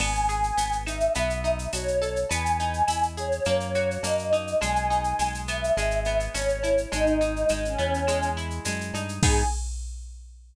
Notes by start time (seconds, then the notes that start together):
0.00 G#1 B3 G#5, crash, cowbell, claves
0.15 shaker
0.29 G#4, shaker
0.43 shaker
0.57 G#1 B3, tambourine, shaker
0.72 shaker
0.86 D#4 E5, claves, shaker
1.00 shaker
1.15 B1 B3, cowbell, shaker
1.30 shaker
1.44 D#4, shaker
1.59 shaker
1.73 B1 F#4 C#5, tambourine, cowbell, claves, shaker
1.88 shaker
2.02 A4, cowbell, shaker
2.16 shaker
2.29 E2 B3 G#5, cowbell, shaker
2.46 shaker
2.59 D#4, shaker
2.73 shaker
2.88 E2 E4, tambourine, claves, shaker
3.03 shaker
3.17 G#4 C#5, shaker
3.32 shaker
3.45 F#2 A#3, cowbell, claves, shaker
3.60 shaker
3.75 F#4, shaker
3.91 shaker
4.03 F#2 A#3 D#5, tambourine, cowbell, shaker
4.19 shaker
4.32 D#4, cowbell, shaker
4.47 shaker
4.61 B1 G#3 G#5, cowbell, claves, shaker
4.76 shaker
4.90 D#4, shaker
5.04 shaker
5.19 B1 G#3, tambourine, shaker
5.34 shaker
5.48 B3 E5, claves, shaker
5.64 shaker
5.77 G#1 G#3, cowbell, shaker
5.91 shaker
6.05 B3, shaker
6.20 shaker
6.34 G#1 C#4 C#5, tambourine, cowbell, claves, shaker
6.49 shaker
6.63 E4, cowbell, shaker
6.78 shaker
6.92 G#1 G#3 D#4, cowbell, shaker
7.06 shaker
7.21 D#4, shaker
7.36 shaker
7.49 G#1 G#3, tambourine, claves, shaker
7.64 C#4, shaker
7.78 E2 B3, shaker
7.94 shaker
8.07 G#3, cowbell, claves, shaker
8.22 shaker
8.37 E4, shaker
8.50 shaker
8.65 F#2 G#3, tambourine, cowbell, shaker
8.81 shaker
8.94 G2 D#4, cowbell, shaker
9.09 shaker
9.23 G#2 B3 D#4 G#4, kick, crash